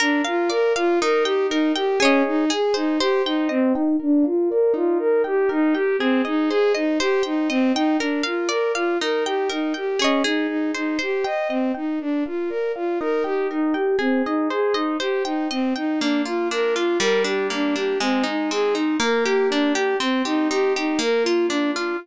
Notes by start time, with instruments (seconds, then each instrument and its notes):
0.00 violin D4, orchestral harp A#4
0.24 violin F4, orchestral harp F5
0.50 violin A#4, orchestral harp D5
0.76 violin F4, orchestral harp F5
1.01 orchestral harp D#4, violin A#4
1.24 violin G4, orchestral harp G5
1.49 violin D#4, orchestral harp A#4
1.76 violin G4, orchestral harp G5
2.00 violin C#4, orchestral harp G#4 C#5
2.05 orchestral harp D#5
2.27 violin D#4
2.50 orchestral harp G#4, violin G#4
2.74 violin D#4, orchestral harp C5
2.99 violin G4, orchestral harp C5
3.25 violin D#4, orchestral harp G5
3.49 violin C4, orchestral harp D#5
3.73 violin D#4, orchestral harp G5
3.99 violin D4, orchestral harp A#4
4.24 violin F4, orchestral harp F5
4.50 violin A#4, orchestral harp D5
4.74 orchestral harp D#4, violin F4
4.99 violin A#4
5.24 violin G4, orchestral harp G5
5.49 violin D#4, orchestral harp A#4
5.74 violin G4, orchestral harp G5
5.99 violin C4, orchestral harp G#4
6.25 violin D#4, orchestral harp D#5
6.49 violin G#4, orchestral harp C5
6.74 violin D#4, orchestral harp D#5
7.00 violin G4, orchestral harp C5
7.23 violin D#4, orchestral harp G5
7.49 violin C4, orchestral harp D#5
7.74 violin D#4, orchestral harp G5
7.99 violin D4, orchestral harp A#4
8.23 violin F4, orchestral harp F5
8.49 violin A#4, orchestral harp D5
8.75 violin F4, orchestral harp F5
9.01 orchestral harp D#4, violin A#4
9.25 violin G4, orchestral harp G5
9.49 violin D#4, orchestral harp A#4
9.74 violin G4, orchestral harp G5
9.99 violin C#4, orchestral harp G#4 C#5
10.04 orchestral harp D#5
10.24 violin D#4, orchestral harp G#4
10.48 violin D#4
10.74 violin D#4, orchestral harp C5
10.99 violin G4, orchestral harp C5
11.24 violin D#5, orchestral harp G5
11.49 violin C4, orchestral harp D#5
11.74 violin D#4, orchestral harp G5
11.99 violin D4, orchestral harp A#4
12.26 violin F4, orchestral harp F5
12.49 violin A#4, orchestral harp D5
12.76 violin F4, orchestral harp F5
13.00 orchestral harp D#4, violin A#4
13.24 violin G4, orchestral harp G5
13.51 violin D#4, orchestral harp A#4
13.74 violin G4, orchestral harp G5
13.99 violin C4, orchestral harp G#4
14.25 violin D#4, orchestral harp D#5
14.50 violin G#4, orchestral harp C5
14.74 violin D#4, orchestral harp D#5
15.00 violin G4, orchestral harp C5
15.25 violin D#4, orchestral harp G5
15.51 violin C4, orchestral harp D#5
15.76 violin D#4, orchestral harp G5
15.99 orchestral harp A#3, violin D4
16.25 violin F4, orchestral harp F4
16.51 orchestral harp D4, violin A#4
16.75 violin F4, orchestral harp F4
16.99 orchestral harp G3, violin A#4
17.24 orchestral harp D4, violin G4
17.50 orchestral harp A#3, violin D4
17.75 orchestral harp D4, violin G4
18.00 orchestral harp G#3, violin C4
18.24 orchestral harp D#4, violin D#4
18.51 orchestral harp C4, violin G#4
18.74 violin D#4, orchestral harp D#4
19.00 orchestral harp A#3, violin A#4
19.25 violin G4, orchestral harp G4
19.49 violin D4, orchestral harp D4
19.73 violin G4, orchestral harp G4
19.99 violin C4, orchestral harp C4
20.25 violin D#4, orchestral harp G4
20.50 orchestral harp D#4, violin G4
20.76 violin D#4, orchestral harp G4
20.99 orchestral harp A#3, violin A#4
21.23 violin F4, orchestral harp F4
21.48 violin D4, orchestral harp D4
21.73 violin F4, orchestral harp F4